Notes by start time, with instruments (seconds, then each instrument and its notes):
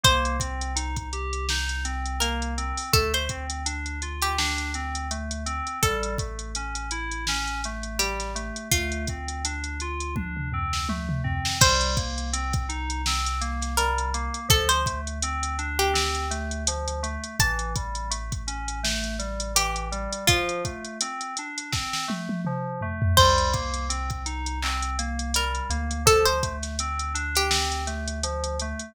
0.03 synth bass 2 C2, electric piano 2 A#3, pizzicato strings C5, kick, closed hi-hat
0.25 closed hi-hat
0.39 electric piano 2 C4, kick, closed hi-hat
0.61 closed hi-hat
0.76 electric piano 2 D#4, closed hi-hat
0.96 kick, closed hi-hat
1.13 electric piano 2 G4, closed hi-hat
1.33 closed hi-hat
1.49 electric piano 2 D#4, snare
1.69 closed hi-hat
1.85 electric piano 2 C4, closed hi-hat
2.06 closed hi-hat
2.20 electric piano 2 A#3, pizzicato strings A#4, closed hi-hat
2.42 closed hi-hat
2.58 electric piano 2 C4, closed hi-hat
2.77 open hi-hat
2.93 synth bass 2 D2, electric piano 2 A3, pizzicato strings A4, kick, closed hi-hat
3.14 pizzicato strings C5, closed hi-hat
3.29 electric piano 2 C4, kick, closed hi-hat
3.50 closed hi-hat
3.66 electric piano 2 D4, closed hi-hat
3.86 closed hi-hat
4.02 electric piano 2 F4, closed hi-hat
4.22 pizzicato strings G4, closed hi-hat
4.38 electric piano 2 D4, snare
4.58 closed hi-hat
4.74 electric piano 2 C4, closed hi-hat
4.95 closed hi-hat
5.11 electric piano 2 A3, closed hi-hat
5.31 closed hi-hat
5.46 electric piano 2 C4, closed hi-hat
5.67 closed hi-hat
5.82 synth bass 2 A1, electric piano 2 G3, pizzicato strings A4, kick, closed hi-hat
6.03 closed hi-hat
6.18 electric piano 2 A3, kick, closed hi-hat
6.39 closed hi-hat
6.55 electric piano 2 C#4, closed hi-hat
6.75 closed hi-hat
6.91 electric piano 2 E4, closed hi-hat
7.11 closed hi-hat
7.27 electric piano 2 C#4, snare
7.47 closed hi-hat
7.64 electric piano 2 A3, closed hi-hat
7.83 closed hi-hat
7.99 electric piano 2 G3, pizzicato strings G4, closed hi-hat
8.20 snare, closed hi-hat
8.35 electric piano 2 A3, closed hi-hat
8.56 closed hi-hat
8.71 synth bass 2 D2, electric piano 2 A3, pizzicato strings F4, kick, closed hi-hat
8.92 closed hi-hat
9.07 electric piano 2 C4, kick, closed hi-hat
9.28 closed hi-hat
9.45 electric piano 2 D4, closed hi-hat
9.64 closed hi-hat
9.80 electric piano 2 F4, closed hi-hat
10.00 closed hi-hat
10.16 electric piano 2 D4, kick, high tom
10.37 mid tom
10.53 electric piano 2 C4, floor tom
10.73 snare
10.89 electric piano 2 A3, high tom
11.09 mid tom
11.24 electric piano 2 C4, floor tom
11.45 snare
11.61 synth bass 2 C2, electric piano 2 G3, pizzicato strings C5, kick, crash
11.81 closed hi-hat
11.97 electric piano 2 A#3, kick, closed hi-hat
12.18 closed hi-hat
12.33 electric piano 2 C4, closed hi-hat
12.53 kick, closed hi-hat
12.69 electric piano 2 D#4, closed hi-hat
12.90 closed hi-hat
13.06 electric piano 2 C4, snare
13.26 closed hi-hat
13.41 electric piano 2 A#3, closed hi-hat
13.62 snare, closed hi-hat
13.77 electric piano 2 G3, pizzicato strings A#4, closed hi-hat
13.98 closed hi-hat
14.14 electric piano 2 A#3, closed hi-hat
14.34 closed hi-hat
14.48 synth bass 2 D2, electric piano 2 F3, pizzicato strings A4, kick, closed hi-hat
14.69 pizzicato strings C5, closed hi-hat
14.86 electric piano 2 A3, kick, closed hi-hat
15.07 closed hi-hat
15.22 electric piano 2 C4, closed hi-hat
15.43 closed hi-hat
15.58 electric piano 2 D4, closed hi-hat
15.79 pizzicato strings G4, closed hi-hat
15.94 electric piano 2 C4, snare
16.15 closed hi-hat
16.31 electric piano 2 A3, closed hi-hat
16.51 closed hi-hat
16.67 electric piano 2 F3, closed hi-hat
16.88 closed hi-hat
17.03 electric piano 2 A3, closed hi-hat
17.24 closed hi-hat
17.39 synth bass 2 A1, electric piano 2 E3, pizzicato strings A5, kick, closed hi-hat
17.59 closed hi-hat
17.76 electric piano 2 G3, kick, closed hi-hat
17.95 closed hi-hat
18.10 electric piano 2 A3, closed hi-hat
18.32 kick, closed hi-hat
18.47 electric piano 2 C#4, closed hi-hat
18.68 closed hi-hat
18.83 electric piano 2 A3, snare
19.04 closed hi-hat
19.19 electric piano 2 G3, closed hi-hat
19.40 closed hi-hat
19.55 electric piano 2 E3, pizzicato strings G4, closed hi-hat
19.76 closed hi-hat
19.92 electric piano 2 G3, closed hi-hat
20.13 closed hi-hat
20.27 electric piano 2 F3, pizzicato strings F4, kick, closed hi-hat
20.49 closed hi-hat
20.65 electric piano 2 A3, kick, closed hi-hat
20.84 closed hi-hat
21.01 electric piano 2 C4, closed hi-hat
21.21 closed hi-hat
21.37 electric piano 2 D4, closed hi-hat
21.58 closed hi-hat
21.72 electric piano 2 C4, kick, snare
21.93 snare
22.08 electric piano 2 A3, high tom
22.29 high tom
22.45 electric piano 2 F3, mid tom
22.81 electric piano 2 A3, floor tom
23.02 floor tom
23.17 synth bass 2 C2, electric piano 2 G3, pizzicato strings C5, kick, crash
23.38 closed hi-hat
23.53 electric piano 2 A#3, kick, closed hi-hat
23.74 closed hi-hat
23.89 electric piano 2 C4, closed hi-hat
24.10 kick, closed hi-hat
24.26 electric piano 2 D#4, closed hi-hat
24.46 closed hi-hat
24.63 electric piano 2 C4, clap
24.82 closed hi-hat
24.98 electric piano 2 A#3, closed hi-hat
25.19 closed hi-hat
25.34 electric piano 2 G3, pizzicato strings A#4, closed hi-hat
25.55 closed hi-hat
25.70 synth bass 2 D2, electric piano 2 A#3, closed hi-hat
25.91 closed hi-hat
26.06 electric piano 2 F3, pizzicato strings A4, kick, closed hi-hat
26.25 pizzicato strings C5, closed hi-hat
26.43 electric piano 2 A3, kick, closed hi-hat
26.63 snare, closed hi-hat
26.79 electric piano 2 C4, closed hi-hat
26.99 closed hi-hat
27.14 electric piano 2 D4, closed hi-hat
27.35 pizzicato strings G4, closed hi-hat
27.50 electric piano 2 C4, snare
27.72 closed hi-hat
27.87 electric piano 2 A3, closed hi-hat
28.08 closed hi-hat
28.23 electric piano 2 F3, closed hi-hat
28.44 closed hi-hat
28.59 electric piano 2 A3, closed hi-hat
28.79 closed hi-hat